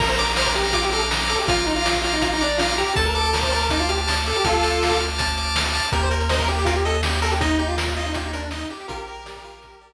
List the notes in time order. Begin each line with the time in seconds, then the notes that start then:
0.00 A#1 A#4 A#5, kick, crash
0.09 C5, closed hi-hat
0.18 A#4 D6, closed hi-hat
0.29 closed hi-hat
0.36 C5 F6, snare
0.46 A#4, kick, closed hi-hat
0.55 G4 A#5, closed hi-hat
0.65 closed hi-hat
0.73 F4 D6, kick, closed hi-hat
0.83 G4, closed hi-hat
0.92 A4 F6, closed hi-hat
1.01 closed hi-hat
1.11 A#5, snare
1.20 closed hi-hat
1.29 A4 D6, closed hi-hat
1.39 G4, open hi-hat
1.47 A#1 F4 F6, kick, closed hi-hat
1.58 closed hi-hat
1.66 D#4 A#5, closed hi-hat
1.76 F4, closed hi-hat
1.85 D6, snare
1.95 kick, closed hi-hat
2.04 F4 F6, closed hi-hat
2.13 D#4, closed hi-hat
2.22 F4 A#5, kick, closed hi-hat
2.32 D#4, closed hi-hat
2.41 D4 D6, closed hi-hat
2.50 closed hi-hat
2.58 F4 F6, snare
2.69 closed hi-hat
2.78 G4 A#5, closed hi-hat
2.86 closed hi-hat
2.96 D2 A4 A5, kick, closed hi-hat
3.05 A#4, closed hi-hat
3.15 A4 D6, closed hi-hat
3.25 closed hi-hat
3.33 A#4 F6, snare
3.41 C5, kick, closed hi-hat
3.52 A#4 A5, closed hi-hat
3.61 closed hi-hat
3.69 D#4 D6, kick, closed hi-hat
3.80 F4, closed hi-hat
3.89 G4 F6, closed hi-hat
3.97 closed hi-hat
4.07 A5, snare
4.17 closed hi-hat
4.26 A4 D6, closed hi-hat
4.35 G4, closed hi-hat
4.44 D2 F4 A4 F6, kick, closed hi-hat
4.53 closed hi-hat
4.63 A5, closed hi-hat
4.71 closed hi-hat
4.82 D6, snare
4.90 kick, closed hi-hat
5.00 F6, closed hi-hat
5.09 closed hi-hat
5.18 A5, kick, closed hi-hat
5.27 closed hi-hat
5.37 D6, closed hi-hat
5.45 closed hi-hat
5.55 F6, snare
5.66 closed hi-hat
5.73 A5, closed hi-hat
5.84 closed hi-hat
5.92 D#2 G4 A#4, kick, closed hi-hat
6.01 C5, closed hi-hat
6.11 A#4, closed hi-hat
6.20 closed hi-hat
6.29 C5 D#5, snare
6.39 A#4, kick, closed hi-hat
6.48 G4, closed hi-hat
6.59 closed hi-hat
6.65 F4 A#4, kick, closed hi-hat
6.76 G4, closed hi-hat
6.85 A4 D#5, closed hi-hat
6.94 closed hi-hat
7.03 G4, snare
7.13 closed hi-hat
7.22 A4 A#4, closed hi-hat
7.31 G4, closed hi-hat
7.41 D#4 D#5, kick, closed hi-hat
7.50 closed hi-hat
7.59 D#4 G4, closed hi-hat
7.68 F4, closed hi-hat
7.78 A#4, snare
7.87 kick, closed hi-hat
7.96 F4 D#5, closed hi-hat
8.06 D#4, closed hi-hat
8.14 F4 G4, kick, closed hi-hat
8.23 D#4, closed hi-hat
8.33 D4 A#4, closed hi-hat
8.42 closed hi-hat
8.51 D#4 D#5, snare
8.61 closed hi-hat
8.70 G4, closed hi-hat
8.80 closed hi-hat
8.88 A#1 F4 G4 A#4, kick, closed hi-hat
8.99 closed hi-hat
9.07 A#4, closed hi-hat
9.17 closed hi-hat
9.26 D5, snare
9.36 kick, closed hi-hat
9.44 F4, closed hi-hat
9.55 closed hi-hat
9.62 A#4, kick, closed hi-hat
9.72 closed hi-hat
9.81 D5, closed hi-hat
9.91 closed hi-hat